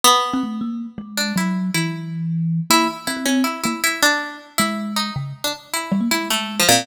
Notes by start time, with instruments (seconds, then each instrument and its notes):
0.04 pizzicato strings B3
0.33 kalimba C4
0.43 kalimba A3
0.61 kalimba A#3
0.98 kalimba G#3
1.17 pizzicato strings D4
1.36 kalimba F#3, pizzicato strings E4
1.74 kalimba E3, pizzicato strings E4
2.70 kalimba A#3, pizzicato strings E4
3.07 kalimba C4, pizzicato strings E4
3.17 kalimba C4
3.25 kalimba C4, pizzicato strings C#4
3.44 pizzicato strings E4
3.64 kalimba A#3, pizzicato strings E4
3.84 pizzicato strings E4
4.02 pizzicato strings D4
4.58 kalimba G#3, pizzicato strings E4
4.96 pizzicato strings D#4
5.16 kalimba C#3
5.44 pizzicato strings D4
5.73 pizzicato strings E4
5.92 kalimba G3
6.01 kalimba A#3
6.11 kalimba G#3, pizzicato strings E4
6.30 pizzicato strings A3
6.59 pizzicato strings F3
6.69 pizzicato strings A#2, kalimba C4